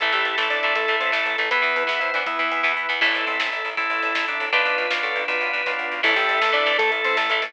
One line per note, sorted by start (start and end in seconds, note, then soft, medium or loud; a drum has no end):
0.00 0.11 A1 medium
0.00 0.13 E3 medium
0.00 0.12 E3 medium
0.00 0.13 A3 medium
0.00 1.49 E4 medium
0.00 1.36 E4 medium
0.00 0.13 E4 medium
0.00 0.73 A4 medium
0.00 1.49 A4 medium
0.00 1.36 A4 medium
0.00 kick loud
0.00 closed hi-hat loud
0.12 0.23 A1 medium
0.12 0.35 E3 medium
0.12 0.37 G3 medium
0.12 0.35 A3 medium
0.12 0.37 G4 medium
0.12 closed hi-hat medium
0.25 0.36 A1 medium
0.25 closed hi-hat medium
0.38 0.48 A1 medium
0.38 0.61 E3 medium
0.38 0.49 A3 medium
0.38 0.61 A3 medium
0.38 0.49 A4 medium
0.38 snare loud
0.50 0.61 A1 medium
0.50 0.75 D4 medium
0.50 0.75 D5 medium
0.50 closed hi-hat medium
0.63 0.74 A1 medium
0.63 0.87 E3 medium
0.63 0.87 A3 medium
0.63 closed hi-hat medium
0.75 0.86 A1 medium
0.75 0.96 A3 medium
0.75 0.96 A4 medium
0.75 1.42 A4 loud
0.75 kick loud
0.75 closed hi-hat loud
0.88 0.99 A1 medium
0.88 1.11 E3 medium
0.88 1.11 A3 medium
0.88 closed hi-hat medium
1.00 1.11 A1 medium
1.00 1.12 C4 medium
1.00 1.12 C5 medium
1.00 closed hi-hat medium
1.12 1.24 A1 medium
1.12 1.35 E3 medium
1.12 1.35 A3 medium
1.12 1.37 A3 medium
1.12 1.37 A4 medium
1.12 snare loud
1.26 1.37 A1 medium
1.26 closed hi-hat medium
1.38 1.49 A1 medium
1.38 1.50 E3 medium
1.38 1.50 A3 medium
1.38 1.50 A4 medium
1.38 closed hi-hat medium
1.50 1.62 E2 medium
1.50 1.61 E3 medium
1.50 1.83 B3 medium
1.50 1.62 B3 medium
1.50 2.20 B3 loud
1.50 3.00 E4 medium
1.50 2.20 E4 loud
1.50 1.83 B4 loud
1.50 3.00 B4 medium
1.50 1.76 B4 medium
1.50 kick loud
1.50 closed hi-hat loud
1.62 1.74 E2 medium
1.62 1.85 E3 medium
1.62 1.85 B3 medium
1.62 closed hi-hat medium
1.76 1.87 E2 medium
1.76 closed hi-hat medium
1.87 1.99 E2 medium
1.87 2.10 E3 medium
1.87 2.10 B3 medium
1.87 1.99 E4 medium
1.87 1.99 E5 medium
1.87 snare loud
2.00 2.12 E2 medium
2.00 2.11 E4 medium
2.00 2.23 C5 medium
2.00 2.11 E5 medium
2.00 closed hi-hat medium
2.14 2.25 E2 medium
2.14 2.38 E3 medium
2.14 2.38 B3 medium
2.14 2.24 D4 medium
2.14 2.24 D5 medium
2.14 closed hi-hat medium
2.26 2.37 E2 medium
2.26 2.38 B3 medium
2.26 2.94 B3 medium
2.26 2.94 E4 medium
2.26 2.72 E4 medium
2.26 2.72 E5 medium
2.26 kick loud
2.26 closed hi-hat loud
2.38 2.50 E2 medium
2.38 2.62 E3 medium
2.38 2.74 B3 medium
2.38 2.62 B3 medium
2.38 closed hi-hat medium
2.52 2.62 E2 medium
2.52 closed hi-hat medium
2.63 2.75 E2 medium
2.63 2.86 E3 medium
2.63 2.86 B3 medium
2.63 kick medium
2.63 snare medium
2.77 2.87 E2 medium
2.89 3.00 E2 medium
2.89 3.00 E3 medium
2.89 3.00 B3 medium
3.01 3.13 A1 medium
3.01 4.40 E3 loud
3.01 4.40 A3 medium
3.01 3.25 E4 loud
3.01 3.69 E4 medium
3.01 4.51 E4 medium
3.01 3.69 A4 medium
3.01 4.51 A4 medium
3.01 kick loud
3.01 crash loud
3.14 3.25 A1 medium
3.14 ride medium
3.26 3.38 A1 medium
3.26 3.50 C4 medium
3.26 ride medium
3.40 3.50 A1 medium
3.40 snare loud
3.52 3.63 A1 medium
3.52 ride medium
3.65 3.76 A1 medium
3.65 ride medium
3.77 3.88 A1 medium
3.77 4.45 E4 medium
3.77 4.26 E4 loud
3.77 4.45 A4 medium
3.77 kick loud
3.77 ride loud
3.90 4.01 A1 medium
3.90 ride medium
4.03 4.13 A1 medium
4.03 ride medium
4.15 4.26 A1 medium
4.15 snare loud
4.28 4.38 A1 medium
4.28 4.49 D4 loud
4.28 ride medium
4.40 4.51 A1 medium
4.40 ride medium
4.52 4.64 B1 loud
4.52 4.86 B3 medium
4.52 4.86 D4 medium
4.52 5.91 D4 loud
4.52 6.02 D4 medium
4.52 4.86 F4 medium
4.52 6.02 F4 medium
4.52 5.91 F4 loud
4.52 4.93 B4 loud
4.52 6.02 B4 loud
4.52 5.91 B4 medium
4.52 kick loud
4.52 ride loud
4.65 4.76 B1 medium
4.65 ride medium
4.78 4.89 B1 medium
4.78 ride medium
4.90 5.01 B1 medium
4.90 5.24 B3 medium
4.90 5.24 D4 medium
4.90 5.24 F4 medium
4.90 snare loud
5.03 5.14 B1 medium
5.03 5.24 A4 loud
5.03 ride medium
5.16 5.26 B1 medium
5.16 ride medium
5.28 5.39 B1 medium
5.28 5.62 B3 medium
5.28 5.62 D4 medium
5.28 5.62 F4 medium
5.28 5.71 B4 loud
5.28 kick loud
5.28 ride loud
5.41 5.52 B1 medium
5.41 ride medium
5.53 5.64 B1 medium
5.53 ride medium
5.66 5.77 B1 medium
5.66 6.01 B3 medium
5.66 6.01 D4 medium
5.66 6.01 F4 medium
5.66 kick loud
5.66 snare medium
5.79 5.89 B1 medium
5.91 6.02 B1 medium
5.91 floor tom loud
6.03 6.15 A1 loud
6.03 6.49 E3 medium
6.03 6.15 E3 loud
6.03 6.49 A3 medium
6.03 6.72 A3 loud
6.03 6.15 E4 loud
6.03 7.53 E4 loud
6.03 6.72 E4 loud
6.03 6.77 A4 loud
6.03 7.53 A4 loud
6.03 kick loud
6.03 crash loud
6.16 6.27 A1 loud
6.16 6.40 G4 loud
6.16 6.40 G5 loud
6.16 closed hi-hat medium
6.29 6.39 A1 medium
6.29 closed hi-hat medium
6.41 6.52 A1 medium
6.41 6.52 A3 medium
6.41 6.52 A4 loud
6.41 snare loud
6.52 6.65 A1 medium
6.52 6.64 E3 medium
6.52 6.64 A3 medium
6.52 6.78 D4 loud
6.52 6.78 D5 loud
6.52 closed hi-hat medium
6.66 6.77 A1 medium
6.66 7.24 E3 medium
6.66 7.24 A3 medium
6.66 closed hi-hat medium
6.78 6.90 A1 medium
6.78 7.46 A3 medium
6.78 6.91 A3 loud
6.78 7.46 E4 medium
6.78 6.91 A4 loud
6.78 7.45 A4 loud
6.78 kick loud
6.78 closed hi-hat loud
6.92 7.02 A1 medium
6.92 closed hi-hat medium
7.04 7.15 A1 medium
7.04 7.16 C4 loud
7.04 7.16 C5 loud
7.04 closed hi-hat medium
7.17 7.28 A1 loud
7.17 7.29 A3 medium
7.17 7.29 A4 loud
7.17 snare loud
7.30 7.40 A1 loud
7.30 7.41 E3 medium
7.30 7.42 A3 medium
7.30 closed hi-hat medium
7.42 7.53 A1 medium
7.42 7.53 E3 medium
7.42 7.53 A3 medium
7.42 7.53 A3 loud
7.42 7.53 A4 loud
7.42 open hi-hat loud